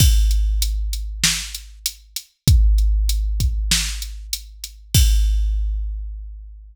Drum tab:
CC |x-------|--------|x-------|
HH |-xxx-xxx|xxxx-xxx|--------|
SD |----o---|----o---|--------|
BD |o-------|o--o----|o-------|